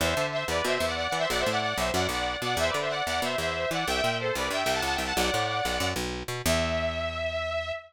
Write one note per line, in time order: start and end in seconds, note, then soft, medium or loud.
0.00 0.14 E2 medium
0.00 0.27 C5 medium
0.00 0.27 E5 medium
0.17 0.44 D3 medium
0.32 0.45 C5 medium
0.32 0.45 E5 medium
0.48 0.62 E2 medium
0.48 0.64 B4 medium
0.48 0.64 D5 medium
0.65 0.78 B2 medium
0.65 0.74 C5 medium
0.65 0.74 E5 loud
0.75 0.85 C5 medium
0.75 0.85 E5 medium
0.80 1.08 E2 medium
0.87 0.96 D5 medium
0.87 0.96 F#5 medium
0.96 1.07 D5 medium
0.96 1.07 F#5 medium
1.08 1.18 D5 medium
1.08 1.18 F#5 medium
1.12 1.26 E3 medium
1.18 1.28 C5 medium
1.18 1.28 E5 loud
1.29 1.44 B1 medium
1.29 1.39 D5 medium
1.29 1.39 F#5 loud
1.39 1.50 C5 medium
1.39 1.50 E5 medium
1.46 1.74 A2 medium
1.46 1.60 D5 medium
1.46 1.60 F#5 loud
1.61 1.77 D5 medium
1.61 1.77 F#5 medium
1.77 1.91 B1 medium
1.77 1.91 C5 medium
1.77 1.91 E5 medium
1.94 2.08 F#2 medium
1.94 2.07 D5 medium
1.94 2.07 F#5 medium
2.09 2.36 B1 medium
2.09 2.38 D5 medium
2.09 2.38 F#5 medium
2.42 2.55 B2 medium
2.42 2.57 D5 medium
2.42 2.57 F#5 medium
2.57 2.71 E2 medium
2.57 2.69 C5 medium
2.57 2.69 E5 loud
2.68 2.78 B4 medium
2.68 2.78 D5 medium
2.74 3.02 D3 medium
2.80 2.90 C5 medium
2.80 2.90 E5 medium
2.89 3.04 D5 medium
2.89 3.04 F#5 medium
3.06 3.21 E2 medium
3.06 3.20 D5 medium
3.06 3.20 F#5 medium
3.22 3.36 B2 medium
3.22 3.36 C5 medium
3.22 3.36 E5 medium
3.38 3.66 E2 medium
3.38 3.69 C5 medium
3.38 3.69 E5 medium
3.71 3.85 E3 medium
3.71 3.86 D5 medium
3.71 3.86 F#5 medium
3.87 4.01 C2 medium
3.87 4.17 E5 medium
3.87 4.17 G5 loud
4.04 4.31 A#2 medium
4.20 4.34 A4 medium
4.20 4.34 C5 medium
4.35 4.49 C2 medium
4.35 4.50 B4 medium
4.35 4.50 D5 medium
4.50 4.64 G2 medium
4.50 4.62 E5 medium
4.50 4.62 G5 medium
4.63 4.81 C2 medium
4.63 4.73 E5 medium
4.63 4.73 G5 loud
4.73 4.83 F#5 medium
4.73 4.83 A5 medium
4.82 4.97 C#2 medium
4.82 4.94 F#5 medium
4.82 4.94 A5 medium
4.94 5.04 E5 medium
4.94 5.04 G5 medium
4.98 5.13 C2 medium
5.04 5.15 F#5 medium
5.04 5.15 A5 medium
5.16 5.31 B1 medium
5.16 5.87 D5 medium
5.16 5.87 F#5 loud
5.34 5.61 A2 medium
5.65 5.79 B1 medium
5.80 5.94 F#2 medium
5.96 6.23 B1 medium
6.28 6.42 B2 medium
6.46 7.72 E2 loud
6.46 7.72 E5 loud